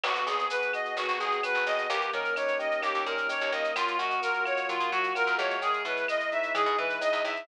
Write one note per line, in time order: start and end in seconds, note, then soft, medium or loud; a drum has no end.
0.03 0.24 G#1 medium
0.03 0.50 B3 medium
0.03 0.25 F#4 medium
0.03 crash loud
0.03 cowbell loud
0.03 claves loud
0.15 shaker medium
0.26 0.48 G#1 medium
0.26 1.19 G#4 medium
0.26 0.48 G#4 medium
0.26 shaker loud
0.39 shaker medium
0.50 0.96 B3 medium
0.50 0.71 B4 medium
0.50 shaker loud
0.62 shaker medium
0.73 1.43 F#4 medium
0.73 0.95 D#5 medium
0.73 claves medium
0.73 shaker medium
0.85 shaker medium
0.96 1.07 G#1 medium
0.96 1.66 B3 medium
0.96 1.19 F#4 medium
0.96 cowbell medium
0.96 shaker loud
1.08 1.19 G#1 medium
1.08 shaker medium
1.20 1.41 G#1 medium
1.20 1.41 G#4 medium
1.20 1.86 G#4 medium
1.20 shaker medium
1.31 shaker medium
1.43 1.88 F#4 medium
1.43 1.64 B4 medium
1.43 cowbell medium
1.43 claves loud
1.43 shaker loud
1.55 1.65 G#1 medium
1.55 shaker medium
1.66 1.87 G#1 medium
1.66 1.88 B3 medium
1.66 1.88 D#5 medium
1.66 cowbell medium
1.66 shaker medium
1.78 shaker medium
1.90 2.11 D#2 loud
1.90 2.82 A#3 medium
1.90 2.11 G4 medium
1.90 cowbell loud
1.90 shaker loud
2.01 shaker medium
2.13 2.34 D#3 medium
2.13 3.05 C#4 medium
2.13 2.34 A#4 medium
2.13 shaker medium
2.25 shaker medium
2.36 3.28 D#4 medium
2.36 2.58 C#5 medium
2.36 claves loud
2.36 shaker loud
2.48 shaker medium
2.59 3.70 G4 medium
2.59 2.81 D#5 medium
2.59 shaker medium
2.71 shaker medium
2.82 2.93 D#2 medium
2.82 3.52 A#3 medium
2.82 3.04 G4 medium
2.82 cowbell medium
2.82 claves medium
2.82 shaker loud
2.94 3.05 D#2 medium
2.94 shaker medium
3.05 3.27 A#2 medium
3.05 3.72 C#4 medium
3.05 3.27 A#4 medium
3.05 shaker medium
3.18 shaker medium
3.29 3.73 D#4 medium
3.29 3.51 C#5 medium
3.29 cowbell loud
3.29 shaker loud
3.41 3.52 D#2 medium
3.41 shaker medium
3.52 3.73 D#2 medium
3.52 4.21 A#3 medium
3.52 3.74 D#5 medium
3.52 cowbell loud
3.52 shaker medium
3.64 shaker medium
3.76 3.97 F#2 loud
3.76 3.97 F4 medium
3.76 cowbell loud
3.76 claves loud
3.76 shaker loud
3.88 shaker medium
3.98 4.20 F#2 medium
3.98 4.92 F#4 medium
3.98 4.21 F#4 medium
3.98 shaker medium
4.10 shaker medium
4.21 4.68 A#3 medium
4.21 4.44 A#4 medium
4.21 shaker loud
4.34 shaker medium
4.45 5.15 F4 medium
4.45 4.67 C#5 medium
4.45 claves loud
4.45 shaker medium
4.57 shaker medium
4.69 4.80 F#3 medium
4.69 5.57 A#3 medium
4.69 4.90 F4 medium
4.69 cowbell medium
4.69 shaker loud
4.80 4.91 C#3 medium
4.80 shaker medium
4.92 5.13 F#3 medium
4.92 5.13 F#4 medium
4.92 5.59 F#4 medium
4.92 shaker medium
5.04 shaker medium
5.15 5.59 F4 medium
5.15 5.37 A#4 medium
5.15 cowbell medium
5.15 claves medium
5.15 shaker loud
5.27 5.38 F#2 medium
5.27 shaker medium
5.38 5.83 E2 loud
5.38 6.07 G#3 medium
5.38 5.60 C#5 medium
5.38 cowbell medium
5.38 shaker medium
5.50 shaker medium
5.62 5.83 G#4 medium
5.62 cowbell loud
5.62 shaker loud
5.73 shaker medium
5.85 6.06 B2 medium
5.85 6.78 E4 medium
5.85 6.07 B4 medium
5.85 shaker medium
5.97 shaker medium
6.07 6.55 G#3 medium
6.07 6.30 D#5 medium
6.07 claves loud
6.07 shaker loud
6.20 shaker medium
6.31 7.00 D#4 medium
6.31 6.53 E5 medium
6.31 shaker medium
6.43 shaker medium
6.55 6.65 E3 medium
6.55 7.24 G#3 medium
6.55 6.76 G#4 medium
6.55 cowbell medium
6.55 claves loud
6.55 shaker loud
6.66 6.77 B2 medium
6.66 shaker medium
6.78 6.99 E3 medium
6.78 7.44 E4 medium
6.78 6.99 B4 medium
6.90 shaker medium
7.01 7.45 D#4 medium
7.01 7.23 D#5 medium
7.01 cowbell medium
7.01 shaker loud
7.13 7.23 E2 medium
7.13 shaker medium
7.25 7.46 E2 medium
7.25 7.47 G#3 medium
7.25 7.46 E5 medium
7.25 cowbell medium
7.25 shaker medium
7.36 shaker medium